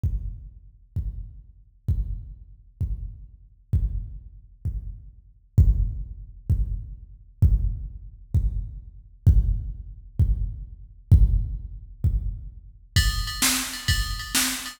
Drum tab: RD |------------|------------|------------|------------|
SD |------------|------------|------------|------------|
BD |o-----o-----|o-----o-----|o-----o-----|o-----o-----|

RD |------------|------------|------------|x-x--xx-x--x|
SD |------------|------------|------------|---o-----o--|
BD |o-----o-----|o-----o-----|o-----o-----|o-----o-----|